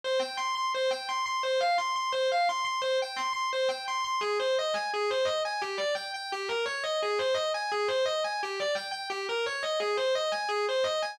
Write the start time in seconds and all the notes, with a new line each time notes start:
0.04 C5
0.19 G5
0.37 C6
0.55 C6
0.74 C5
0.91 G5
1.09 C6
1.26 C6
1.43 C5
1.60 F5
1.78 C6
1.96 C6
2.12 C5
2.32 F5
2.49 C6
2.65 C6
2.82 C5
3.02 G5
3.16 C6
3.33 C6
3.53 C5
3.68 G5
3.88 C6
4.04 C6
4.21 G#4
4.39 C5
4.59 D#5
4.74 G#5
4.94 G#4
5.10 C5
5.25 D#5
5.45 G#5
5.61 G4
5.78 D5
5.95 G5
6.14 G5
6.32 G4
6.48 A#4
6.66 C#5
6.84 D#5
7.02 G#4
7.19 C5
7.34 D#5
7.54 G#5
7.72 G#4
7.88 C5
8.06 D#5
8.24 G#5
8.43 G4
8.60 D5
8.75 G5
8.91 G5
9.10 G4
9.29 A#4
9.46 C#5
9.63 D#5
9.80 G#4
9.97 C5
10.15 D#5
10.32 G#5
10.49 G#4
10.69 C5
10.84 D#5
11.02 G#5